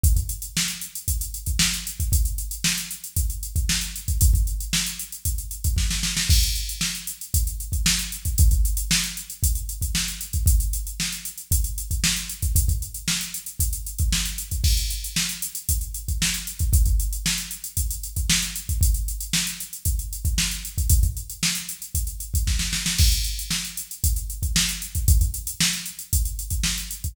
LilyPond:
\new DrumStaff \drummode { \time 4/4 \tempo 4 = 115 <hh bd>16 <hh bd>16 hh16 hh16 sn16 hh16 hh16 hh16 <hh bd>16 hh16 hh16 <hh bd>16 sn16 hh16 hh16 <hh bd>16 | <hh bd>16 hh16 hh16 hh16 sn16 hh16 hh16 hh16 <hh bd>16 hh16 hh16 <hh bd>16 sn16 hh16 hh16 <hh bd>16 | <hh bd>16 <hh bd>16 hh16 hh16 sn16 hh16 hh16 hh16 <hh bd>16 hh16 hh16 <hh bd>16 <bd sn>16 sn16 sn16 sn16 | <cymc bd>16 hh16 hh16 hh16 sn16 hh16 hh16 hh16 <hh bd>16 hh16 hh16 <hh bd>16 sn16 hh16 hh16 <hh bd>16 |
<hh bd>16 <hh bd>16 hh16 hh16 sn16 hh16 hh16 hh16 <hh bd>16 hh16 hh16 <hh bd>16 sn16 hh16 hh16 <hh bd>16 | <hh bd>16 hh16 hh16 hh16 sn16 hh16 hh16 hh16 <hh bd>16 hh16 hh16 <hh bd>16 sn16 hh16 hh16 <hh bd>16 | <hh bd>16 <hh bd>16 hh16 hh16 sn16 hh16 hh16 hh16 <hh bd>16 hh16 hh16 <hh bd>16 sn16 hh16 hh16 <hh bd>16 | <cymc bd>16 hh16 hh16 hh16 sn16 hh16 hh16 hh16 <hh bd>16 hh16 hh16 <hh bd>16 sn16 hh16 hh16 <hh bd>16 |
<hh bd>16 <hh bd>16 hh16 hh16 sn16 hh16 hh16 hh16 <hh bd>16 hh16 hh16 <hh bd>16 sn16 hh16 hh16 <hh bd>16 | <hh bd>16 hh16 hh16 hh16 sn16 hh16 hh16 hh16 <hh bd>16 hh16 hh16 <hh bd>16 sn16 hh16 hh16 <hh bd>16 | <hh bd>16 <hh bd>16 hh16 hh16 sn16 hh16 hh16 hh16 <hh bd>16 hh16 hh16 <hh bd>16 <bd sn>16 sn16 sn16 sn16 | <cymc bd>16 hh16 hh16 hh16 sn16 hh16 hh16 hh16 <hh bd>16 hh16 hh16 <hh bd>16 sn16 hh16 hh16 <hh bd>16 |
<hh bd>16 <hh bd>16 hh16 hh16 sn16 hh16 hh16 hh16 <hh bd>16 hh16 hh16 <hh bd>16 sn16 hh16 hh16 <hh bd>16 | }